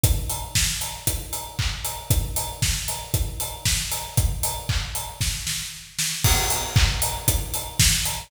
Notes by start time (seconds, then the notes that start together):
0.04 kick, closed hi-hat
0.30 open hi-hat
0.55 kick, snare
0.81 open hi-hat
1.07 kick, closed hi-hat
1.33 open hi-hat
1.59 kick, clap
1.85 open hi-hat
2.10 kick, closed hi-hat
2.36 open hi-hat
2.62 kick, snare
2.88 open hi-hat
3.14 kick, closed hi-hat
3.40 open hi-hat
3.66 kick, snare
3.92 open hi-hat
4.17 kick, closed hi-hat
4.43 open hi-hat
4.69 kick, clap
4.95 open hi-hat
5.21 kick, snare
5.47 snare
5.99 snare
6.24 kick, crash
6.50 open hi-hat
6.76 kick, clap
7.02 open hi-hat
7.28 kick, closed hi-hat
7.54 open hi-hat
7.80 kick, snare
8.05 open hi-hat